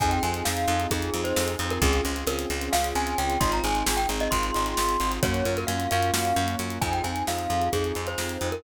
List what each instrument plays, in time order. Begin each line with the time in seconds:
0.00 electric bass (finger) F2, acoustic grand piano C4 D#4 F4 G#4, glockenspiel G#5, kick, closed hi-hat
0.11 glockenspiel G5, closed hi-hat
0.23 electric bass (finger) F2, acoustic grand piano C4 D#4 F4 G#4, glockenspiel G#5, closed hi-hat
0.34 closed hi-hat
0.45 electric bass (finger) F2, acoustic grand piano C4 D#4 F4 G#4, glockenspiel F5, snare
0.57 closed hi-hat
0.68 electric bass (finger) F2, acoustic grand piano C4 D#4 F4 G#4, closed hi-hat
0.80 closed hi-hat
0.91 electric bass (finger) F2, acoustic grand piano C4 D#4 F4 G#4, glockenspiel G#4, kick, closed hi-hat
1.02 closed hi-hat
1.14 electric bass (finger) F2, acoustic grand piano C4 D#4 F4 G#4, closed hi-hat
1.24 glockenspiel C5, closed hi-hat
1.36 electric bass (finger) F2, snare
1.48 closed hi-hat
1.59 electric bass (finger) F2, acoustic grand piano C4 D#4 F4 G#4, closed hi-hat
1.70 glockenspiel A#4, closed hi-hat
1.82 electric bass (finger) C#2, acoustic grand piano C4 C#4 F4 G#4, glockenspiel G#4, kick, closed hi-hat
1.93 closed hi-hat
2.05 electric bass (finger) C#2, acoustic grand piano C4 C#4 F4 G#4, closed hi-hat
2.16 closed hi-hat
2.27 electric bass (finger) C#2, acoustic grand piano C4 C#4 F4 G#4, glockenspiel A#4, closed hi-hat
2.39 closed hi-hat
2.50 electric bass (finger) C#2, acoustic grand piano C4 C#4 F4 G#4, closed hi-hat
2.61 closed hi-hat
2.73 electric bass (finger) C#2, acoustic grand piano C4 C#4 F4 G#4, glockenspiel F5, snare
2.84 closed hi-hat
2.95 electric bass (finger) C#2, acoustic grand piano C4 C#4 F4 G#4, glockenspiel G#5, closed hi-hat
3.07 closed hi-hat
3.18 electric bass (finger) C#2, glockenspiel G5, closed hi-hat
3.30 closed hi-hat
3.40 electric bass (finger) G#1, acoustic grand piano C4 D#4 F4 G#4, glockenspiel C6, kick, closed hi-hat
3.52 glockenspiel A#5, closed hi-hat
3.63 electric bass (finger) G#1, acoustic grand piano C4 D#4 F4 G#4, glockenspiel G#5, closed hi-hat
3.75 closed hi-hat
3.86 electric bass (finger) G#1, acoustic grand piano C4 D#4 F4 G#4, snare
3.97 glockenspiel G5, closed hi-hat
4.09 electric bass (finger) G#1, acoustic grand piano C4 D#4 F4 G#4, closed hi-hat
4.20 glockenspiel D#5, closed hi-hat
4.31 electric bass (finger) G#1, acoustic grand piano C4 D#4 F4 G#4, glockenspiel C6, kick, closed hi-hat
4.43 closed hi-hat
4.54 electric bass (finger) G#1, acoustic grand piano C4 D#4 F4 G#4, closed hi-hat
4.66 closed hi-hat
4.77 electric bass (finger) G#1, snare
4.89 closed hi-hat
5.00 electric bass (finger) G#1, acoustic grand piano C4 D#4 F4 G#4, closed hi-hat
5.12 closed hi-hat
5.23 electric bass (finger) F#2, acoustic grand piano A#3 C#4 F4 F#4, glockenspiel C#5, kick, closed hi-hat
5.34 closed hi-hat
5.45 electric bass (finger) F#2, acoustic grand piano A#3 C#4 F4 F#4, closed hi-hat
5.57 glockenspiel A#4, closed hi-hat
5.67 electric bass (finger) F#2, acoustic grand piano A#3 C#4 F4 F#4, glockenspiel F5, closed hi-hat
5.80 closed hi-hat
5.91 electric bass (finger) F#2, acoustic grand piano A#3 C#4 F4 F#4, glockenspiel F5, closed hi-hat
6.03 closed hi-hat
6.13 electric bass (finger) F#2, acoustic grand piano A#3 C#4 F4 F#4, snare
6.25 closed hi-hat
6.36 electric bass (finger) F#2, acoustic grand piano A#3 C#4 F4 F#4, closed hi-hat
6.48 closed hi-hat
6.59 electric bass (finger) F#2, closed hi-hat
6.70 closed hi-hat
6.81 electric bass (finger) F2, acoustic grand piano C4 D#4 F4 G#4, glockenspiel G#5, kick, closed hi-hat
6.92 glockenspiel G5, closed hi-hat
7.04 electric bass (finger) F2, acoustic grand piano C4 D#4 F4 G#4, glockenspiel G#5, closed hi-hat
7.16 closed hi-hat
7.27 electric bass (finger) F2, acoustic grand piano C4 D#4 F4 G#4, glockenspiel F5, snare
7.38 closed hi-hat
7.50 electric bass (finger) F2, acoustic grand piano C4 D#4 F4 G#4, closed hi-hat
7.61 closed hi-hat
7.73 electric bass (finger) F2, acoustic grand piano C4 D#4 F4 G#4, glockenspiel G#4, kick, closed hi-hat
7.84 closed hi-hat
7.95 electric bass (finger) F2, acoustic grand piano C4 D#4 F4 G#4, closed hi-hat
8.07 glockenspiel C5, closed hi-hat
8.18 electric bass (finger) F2, snare
8.29 closed hi-hat
8.41 electric bass (finger) F2, acoustic grand piano C4 D#4 F4 G#4, closed hi-hat
8.52 glockenspiel A#4, closed hi-hat